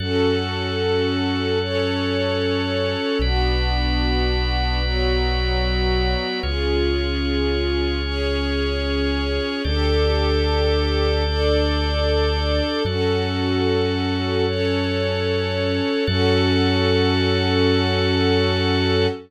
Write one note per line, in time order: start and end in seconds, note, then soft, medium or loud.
0.00 2.96 F#2 medium
0.00 1.59 C#4 medium
0.00 1.59 F#4 medium
0.00 3.18 F#4 medium
0.00 1.59 A4 medium
0.00 3.18 A4 medium
0.00 3.18 C#5 medium
1.61 3.20 C#4 medium
1.61 3.20 A4 medium
1.61 3.20 C#5 medium
3.19 6.15 B1 medium
3.19 4.81 B3 loud
3.19 4.81 D4 medium
3.19 6.40 F#4 medium
3.19 4.81 F#4 medium
3.19 6.40 B4 medium
3.19 6.40 D5 medium
4.82 6.41 F#3 medium
4.82 6.41 B3 medium
4.82 6.41 F#4 medium
6.42 9.39 C#2 medium
6.42 8.02 C#4 medium
6.42 8.02 F4 medium
6.42 9.61 F4 medium
6.42 8.02 G#4 medium
6.42 9.61 G#4 medium
6.42 9.61 C#5 medium
8.03 9.62 C#4 medium
8.03 9.62 G#4 medium
8.03 9.62 C#5 medium
9.64 12.61 D2 medium
9.64 11.23 D4 medium
9.64 11.23 G4 medium
9.64 12.83 G4 medium
9.64 11.23 A4 loud
9.64 12.83 A4 medium
9.64 12.83 D5 medium
11.24 12.83 D4 medium
11.24 12.83 A4 medium
11.24 12.83 D5 medium
12.85 15.80 F#2 medium
12.85 14.45 C#4 medium
12.85 16.04 F#4 medium
12.85 14.45 F#4 loud
12.85 16.04 A4 medium
12.85 14.45 A4 medium
12.85 16.04 C#5 medium
14.46 16.06 C#4 medium
14.46 16.06 A4 medium
14.46 16.06 C#5 medium
16.07 19.07 F#2 loud
16.07 19.07 C#4 loud
16.07 19.07 F#4 loud
16.07 19.07 A4 loud
16.07 19.07 C#5 loud